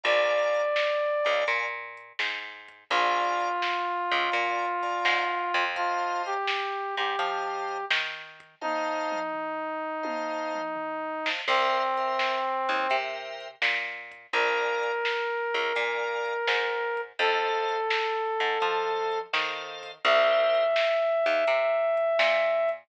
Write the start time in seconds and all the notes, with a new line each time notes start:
0.03 A#1 D5 F5 G#5 A#5, kick, closed hi-hat
0.54 closed hi-hat
0.76 snare
1.24 C#2 D5 F5 G#5 A#5, kick, closed hi-hat
1.47 A#2, kick, closed hi-hat
1.97 closed hi-hat
2.19 G#2, snare
2.68 kick, closed hi-hat
2.90 A#1 F4 D5 F5 G#5 A#5, kick, closed hi-hat
3.40 closed hi-hat
3.62 snare
4.11 C#2, closed hi-hat
4.31 A#2 D5 F5 G#5 A#5, kick, closed hi-hat
4.82 D5 F5 G#5 A#5, kick, closed hi-hat
5.05 G#2, snare
5.54 F2, kick, closed hi-hat
5.76 F4 C5 D#5 F5 A5, kick, closed hi-hat
6.26 G4, closed hi-hat
6.47 snare
6.97 G#2 G4, kick, closed hi-hat
7.19 F3 C5 D#5 F5 A5, kick, closed hi-hat
7.69 closed hi-hat
7.90 D#3, snare
8.40 kick, closed hi-hat
8.61 D#4 C5 D#5 F5 A5, kick, high tom
9.12 mid tom
9.33 floor tom
10.03 C5 D#5 F5 A5, high tom
10.54 mid tom
10.76 floor tom
11.26 C5 D#5 F5 A5, snare
11.48 C2 C4 A#4 C5 E5 G5, kick, crash
11.97 A#4 C5 E5 G5, closed hi-hat
12.19 snare
12.69 D#2, kick, closed hi-hat
12.89 C3 A#4 C5 E5 G5, kick, closed hi-hat
13.40 closed hi-hat
13.62 A#2, snare
14.11 kick, closed hi-hat
14.33 A#1 A#4 D5 F5 G#5, kick, closed hi-hat
14.83 closed hi-hat
15.05 snare
15.54 C#2, closed hi-hat
15.75 A#2 A#4 D5 F5 G#5, kick, closed hi-hat
16.26 kick, closed hi-hat
16.47 G#2, snare
16.97 kick, closed hi-hat
17.19 F2 A4 C5 D#5 F5, kick, closed hi-hat
17.69 closed hi-hat
17.90 snare
18.40 G#2, kick, closed hi-hat
18.60 F3 A4 C5 D#5 F5, kick, closed hi-hat
19.12 closed hi-hat
19.33 D#3 A4 C5 D#5 F5, snare
19.83 kick, open hi-hat
20.04 C2 G4 A#4 C5 E5, kick, closed hi-hat
20.55 closed hi-hat
20.76 snare
21.26 D#2, closed hi-hat
21.47 C3, kick, closed hi-hat
21.97 kick, closed hi-hat
22.19 A#2, snare
22.69 kick, closed hi-hat